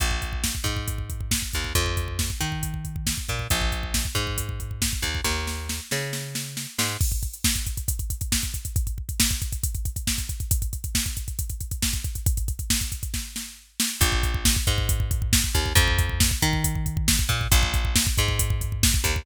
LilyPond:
<<
  \new Staff \with { instrumentName = "Electric Bass (finger)" } { \clef bass \time 4/4 \key bes \minor \tempo 4 = 137 bes,,4. aes,2 ees,8 | f,4. ees2 bes,8 | bes,,4. aes,2 ees,8 | ees,4. des2 aes,8 |
r1 | r1 | r1 | r1 |
bes,,4. aes,2 ees,8 | f,4. ees2 bes,8 | bes,,4. aes,2 ees,8 | }
  \new DrumStaff \with { instrumentName = "Drums" } \drummode { \time 4/4 <hh bd>16 bd16 <hh bd>16 bd16 <bd sn>16 bd16 <hh bd>16 bd16 <hh bd>16 bd16 <hh bd>16 bd16 <bd sn>16 bd16 <hh bd>16 bd16 | <hh bd>16 bd16 <hh bd>16 bd16 <bd sn>16 bd16 <hh bd>16 bd16 <hh bd>16 bd16 <hh bd>16 bd16 <bd sn>16 bd16 <hh bd>16 bd16 | <hh bd>16 bd16 <hh bd>16 bd16 <bd sn>16 bd16 <hh bd>16 bd16 <hh bd>16 bd16 <hh bd>16 bd16 <bd sn>16 bd16 <hh bd>16 bd16 | <bd sn>8 sn8 sn8 sn8 sn8 sn8 sn8 sn8 |
<cymc bd>16 <hh bd>16 <hh bd>16 hh16 <bd sn>16 <hh bd>16 <hh bd>16 <hh bd>16 <hh bd>16 <hh bd>16 <hh bd>16 <hh bd>16 <bd sn>16 <hh bd>16 <hh bd>16 <hh bd>16 | <hh bd>16 <hh bd>16 bd16 <hh bd>16 <hh bd sn>16 <hh bd>16 <hh bd>16 <hh bd>16 <hh bd>16 <hh bd>16 <hh bd>16 <hh bd>16 <bd sn>16 <hh bd>16 <hh bd>16 <hh bd>16 | <hh bd>16 <hh bd>16 <hh bd>16 <hh bd>16 <bd sn>16 <hh bd>16 <hh bd>16 <hh bd>16 <hh bd>16 <hh bd>16 <hh bd>16 <hh bd>16 <bd sn>16 <hh bd>16 <hh bd>16 <hh bd>16 | <hh bd>16 <hh bd>16 <hh bd>16 <hh bd>16 <bd sn>16 <hh bd>16 <hh bd>16 <hh bd>16 <bd sn>8 sn8 r8 sn8 |
<hh bd>16 bd16 <hh bd>16 bd16 <bd sn>16 bd16 <hh bd>16 bd16 <hh bd>16 bd16 <hh bd>16 bd16 <bd sn>16 bd16 <hh bd>16 bd16 | <hh bd>16 bd16 <hh bd>16 bd16 <bd sn>16 bd16 <hh bd>16 bd16 <hh bd>16 bd16 <hh bd>16 bd16 <bd sn>16 bd16 <hh bd>16 bd16 | <hh bd>16 bd16 <hh bd>16 bd16 <bd sn>16 bd16 <hh bd>16 bd16 <hh bd>16 bd16 <hh bd>16 bd16 <bd sn>16 bd16 <hh bd>16 bd16 | }
>>